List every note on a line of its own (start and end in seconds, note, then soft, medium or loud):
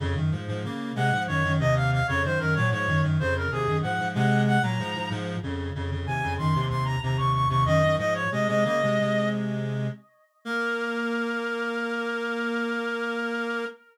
0.00 0.14 F2 loud
0.00 0.14 C#3 loud
0.16 0.31 F#2 medium
0.16 0.31 D#3 medium
0.32 0.47 G#2 medium
0.32 0.47 F3 medium
0.47 0.63 G#2 medium
0.47 0.63 F3 medium
0.64 0.92 C#3 medium
0.64 0.92 A#3 medium
0.95 1.11 C3 medium
0.95 1.11 G#3 loud
0.95 1.23 F#5 loud
1.12 1.27 G#2 medium
1.12 1.27 F3 medium
1.27 1.43 F#2 medium
1.27 1.43 D#3 medium
1.27 1.53 C#5 loud
1.44 1.59 F#2 medium
1.44 1.59 D#3 medium
1.59 2.00 D#2 medium
1.59 2.00 C3 loud
1.59 1.75 D#5 loud
1.76 1.91 F5 loud
1.92 2.07 F5 loud
2.07 2.23 F2 medium
2.07 2.23 C#3 loud
2.07 2.22 C#5 loud
2.24 2.39 F#2 medium
2.24 2.39 D#3 medium
2.24 2.39 C5 loud
2.39 2.55 F#2 medium
2.39 2.55 D#3 medium
2.39 2.54 A#4 loud
2.54 2.72 A#2 medium
2.54 2.72 F#3 medium
2.54 2.69 C#5 loud
2.71 2.86 G#2 medium
2.71 2.86 F3 medium
2.71 3.02 C#5 loud
2.87 3.02 F#2 medium
2.87 3.02 D#3 medium
3.03 3.18 F#2 medium
3.03 3.18 D#3 medium
3.19 3.47 F2 medium
3.19 3.47 C#3 loud
3.19 3.34 C5 loud
3.36 3.51 A#4 medium
3.51 3.66 D#2 medium
3.51 3.66 C3 medium
3.51 3.77 G#4 loud
3.67 3.82 F#2 medium
3.67 3.82 D#3 medium
3.82 3.98 G#2 medium
3.82 3.98 F3 medium
3.82 4.08 F#5 loud
3.99 4.14 G#2 medium
3.99 4.14 F3 medium
4.15 4.58 C3 medium
4.15 4.58 G#3 loud
4.15 4.42 F#5 loud
4.47 4.62 F#5 loud
4.62 4.77 A#2 medium
4.62 4.77 F#3 medium
4.62 5.09 A#5 loud
4.79 4.94 G#2 medium
4.79 4.94 F3 loud
4.95 5.10 G#2 medium
4.95 5.10 F3 medium
5.10 5.36 G#2 loud
5.10 5.36 F3 loud
5.43 5.70 F2 medium
5.43 5.70 C#3 medium
5.75 5.90 F2 medium
5.75 5.90 C#3 medium
5.91 6.06 F2 medium
5.91 6.06 C#3 medium
6.06 6.22 D#2 medium
6.06 6.22 C3 medium
6.06 6.34 G#5 loud
6.23 6.38 F2 medium
6.23 6.38 C#3 medium
6.38 6.54 F#2 medium
6.38 6.54 D#3 medium
6.38 6.65 C6 loud
6.55 6.69 D#2 medium
6.55 6.69 C3 medium
6.69 6.96 D#2 medium
6.69 6.96 C3 medium
6.69 6.84 C6 loud
6.85 7.00 A#5 loud
7.02 7.17 D#2 medium
7.02 7.17 C3 medium
7.02 7.17 A#5 loud
7.17 7.46 D#2 medium
7.17 7.46 C3 medium
7.17 7.33 C#6 loud
7.34 7.48 C#6 loud
7.49 7.64 D#2 medium
7.49 7.64 C3 loud
7.49 7.64 C#6 loud
7.65 7.81 F#2 medium
7.65 7.81 D#3 loud
7.65 7.96 D#5 loud
7.82 7.97 F#2 medium
7.82 7.97 D#3 medium
7.98 8.24 G#2 medium
7.98 8.24 F3 medium
7.98 8.14 D#5 loud
8.14 8.30 C#5 loud
8.32 8.47 C3 medium
8.32 8.47 G#3 medium
8.32 8.47 D#5 loud
8.48 8.64 C3 medium
8.48 8.64 G#3 medium
8.48 8.64 D#5 loud
8.65 8.81 C#3 medium
8.65 8.81 A#3 medium
8.65 9.29 D#5 loud
8.82 8.99 C3 medium
8.82 8.99 G#3 medium
8.99 9.87 C3 medium
8.99 9.87 G#3 medium
10.45 13.65 A#3 loud
10.45 13.65 A#4 loud